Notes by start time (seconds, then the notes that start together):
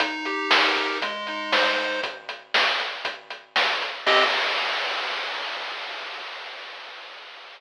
0.00 D#4, kick, closed hi-hat
0.25 G4, closed hi-hat
0.50 A#4, snare
0.76 D#4, kick, closed hi-hat
1.02 G#3, kick, closed hi-hat
1.27 D#4, closed hi-hat
1.52 C5, snare
1.77 G#3, closed hi-hat
2.03 kick, closed hi-hat
2.29 closed hi-hat
2.54 snare
2.80 closed hi-hat
3.05 kick, closed hi-hat
3.30 closed hi-hat
3.56 snare
3.82 closed hi-hat
4.06 C4 G4 D#5, kick, crash